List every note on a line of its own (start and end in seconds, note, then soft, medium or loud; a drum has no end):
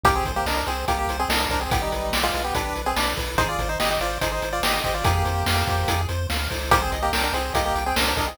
0.03 0.21 C2 medium
0.03 0.15 A#3 medium
0.03 0.15 G4 medium
0.03 0.24 G4 loud
0.03 kick medium
0.03 closed hi-hat medium
0.15 0.32 C4 medium
0.15 0.32 G#4 medium
0.25 0.42 C2 medium
0.25 0.45 C5 medium
0.25 kick medium
0.25 closed hi-hat medium
0.36 0.46 A#3 medium
0.36 0.46 G4 medium
0.46 0.63 C2 medium
0.46 0.56 D4 medium
0.46 0.56 A#4 medium
0.46 0.65 D#5 medium
0.46 snare medium
0.57 0.67 D4 medium
0.57 0.67 A#4 medium
0.66 0.85 C2 medium
0.66 0.85 C4 medium
0.66 0.85 G#4 medium
0.66 0.85 C5 medium
0.66 closed hi-hat medium
0.88 1.06 C2 medium
0.88 0.98 A#3 medium
0.88 1.07 G4 loud
0.88 0.98 G4 medium
0.88 kick medium
0.88 closed hi-hat medium
0.99 1.17 A#3 medium
0.99 1.17 G4 medium
1.07 1.25 C2 medium
1.07 1.28 C5 medium
1.07 closed hi-hat medium
1.19 1.29 C4 medium
1.19 1.29 G#4 medium
1.28 1.46 C2 medium
1.28 1.40 D4 medium
1.28 1.40 A#4 medium
1.28 1.48 D#5 medium
1.28 snare loud
1.40 1.50 D4 medium
1.40 1.50 A#4 medium
1.49 1.67 C2 medium
1.49 1.60 D4 medium
1.49 1.60 A#4 medium
1.49 1.69 C5 medium
1.49 kick medium
1.49 closed hi-hat medium
1.61 1.71 C4 medium
1.61 1.71 G#4 medium
1.70 1.88 B1 medium
1.70 1.81 B3 medium
1.70 1.90 G4 loud
1.70 1.81 G4 medium
1.70 kick loud
1.70 closed hi-hat medium
1.82 2.18 G3 medium
1.82 2.18 D#4 medium
1.92 2.11 B1 medium
1.92 2.11 B4 medium
1.92 closed hi-hat medium
2.12 2.30 B1 medium
2.12 2.32 D5 medium
2.12 snare loud
2.23 2.43 G#3 medium
2.23 2.43 F4 medium
2.34 2.52 B1 medium
2.34 2.53 B4 medium
2.34 closed hi-hat medium
2.44 2.54 B3 medium
2.44 2.54 G4 medium
2.55 2.73 B1 medium
2.55 2.82 D4 medium
2.55 2.74 G4 loud
2.55 2.82 B4 medium
2.55 kick medium
2.55 closed hi-hat medium
2.76 2.94 B1 medium
2.76 2.95 B4 medium
2.76 closed hi-hat medium
2.86 2.96 C4 medium
2.86 2.96 G#4 medium
2.96 3.14 B1 medium
2.96 3.14 D4 medium
2.96 3.14 B4 medium
2.96 3.16 D5 medium
2.96 snare medium
3.17 3.36 B1 medium
3.17 3.36 B4 medium
3.17 kick medium
3.17 open hi-hat medium
3.38 3.56 G#1 medium
3.38 3.48 D#4 medium
3.38 3.57 G#4 loud
3.38 3.48 C5 medium
3.38 kick medium
3.38 closed hi-hat medium
3.49 3.68 F4 medium
3.49 3.68 D5 medium
3.58 3.76 G#1 medium
3.58 3.78 C5 medium
3.58 kick medium
3.58 closed hi-hat medium
3.69 3.79 D#4 medium
3.69 3.79 C5 medium
3.80 3.98 G#1 medium
3.80 3.89 G4 medium
3.80 3.89 D#5 medium
3.80 3.99 D#5 medium
3.80 snare medium
3.90 4.00 G4 medium
3.90 4.00 D#5 medium
4.00 4.18 G#1 medium
4.00 4.18 F4 medium
4.00 4.20 C5 medium
4.00 4.18 D5 medium
4.00 closed hi-hat medium
4.21 4.39 G#1 medium
4.21 4.31 D#4 medium
4.21 4.41 G#4 medium
4.21 4.31 C5 medium
4.21 kick medium
4.21 closed hi-hat medium
4.32 4.49 D#4 medium
4.32 4.49 C5 medium
4.42 4.60 G#1 medium
4.42 4.62 C5 medium
4.42 closed hi-hat medium
4.53 4.63 F4 medium
4.53 4.63 D5 medium
4.62 4.80 G#1 medium
4.62 4.73 G4 medium
4.62 4.81 D#5 medium
4.62 4.73 D#5 medium
4.62 snare loud
4.73 4.83 G4 medium
4.73 4.83 D#5 medium
4.84 5.02 G#1 medium
4.84 4.94 G4 medium
4.84 5.03 C5 medium
4.84 4.94 D#5 medium
4.84 kick medium
4.84 closed hi-hat medium
4.94 5.04 F4 medium
4.94 5.04 D5 medium
5.04 5.24 F2 medium
5.04 6.01 A#3 medium
5.04 6.01 G4 medium
5.04 5.23 G#4 loud
5.04 kick loud
5.04 closed hi-hat medium
5.25 5.43 F2 medium
5.25 5.44 C5 medium
5.25 closed hi-hat medium
5.46 5.64 F2 medium
5.46 5.65 F5 medium
5.46 snare medium
5.67 5.85 F2 medium
5.67 5.87 C5 medium
5.67 kick medium
5.67 closed hi-hat medium
5.88 6.06 F2 medium
5.88 6.07 G#4 medium
5.88 kick medium
5.88 closed hi-hat loud
6.09 6.27 F2 medium
6.09 6.27 C5 medium
6.09 closed hi-hat medium
6.29 6.48 D2 medium
6.29 6.48 F5 medium
6.29 snare medium
6.50 6.71 C#2 medium
6.50 6.69 C5 medium
6.50 kick medium
6.50 open hi-hat medium
6.71 6.89 C2 medium
6.71 6.81 A#3 medium
6.71 6.81 G4 medium
6.71 6.91 C5 loud
6.71 kick medium
6.71 closed hi-hat medium
6.82 6.99 C4 medium
6.82 6.99 G#4 medium
6.92 7.10 C2 medium
6.92 7.11 D#5 medium
6.92 closed hi-hat medium
7.02 7.12 A#3 medium
7.02 7.12 G4 medium
7.13 7.30 C2 medium
7.13 7.23 D4 medium
7.13 7.23 A#4 medium
7.13 7.32 G5 medium
7.13 snare medium
7.23 7.33 D4 medium
7.23 7.33 A#4 medium
7.33 7.50 C2 medium
7.33 7.54 C4 medium
7.33 7.54 G#4 medium
7.33 7.53 C5 medium
7.33 closed hi-hat medium
7.54 7.72 C2 medium
7.54 7.64 A#3 medium
7.54 7.64 G4 medium
7.54 7.73 D#5 loud
7.54 kick medium
7.54 closed hi-hat medium
7.65 7.84 A#3 medium
7.65 7.84 G4 medium
7.75 7.93 C2 medium
7.75 7.95 G5 medium
7.75 closed hi-hat medium
7.86 7.96 C4 medium
7.86 7.96 G#4 medium
7.96 8.14 C2 medium
7.96 8.06 D4 medium
7.96 8.06 A#4 medium
7.96 8.15 C5 medium
7.96 snare loud
8.07 8.17 D4 medium
8.07 8.17 A#4 medium
8.17 8.34 C2 medium
8.17 8.27 D4 medium
8.17 8.27 A#4 medium
8.17 8.36 D#5 medium
8.17 kick medium
8.17 open hi-hat medium
8.28 8.37 C4 medium
8.28 8.37 G#4 medium